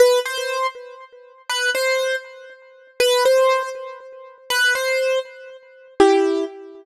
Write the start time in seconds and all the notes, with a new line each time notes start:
0.00 B4
0.26 C5
1.49 B4
1.75 C5
3.00 B4
3.25 C5
4.50 B4
4.75 C5
6.00 E4 G4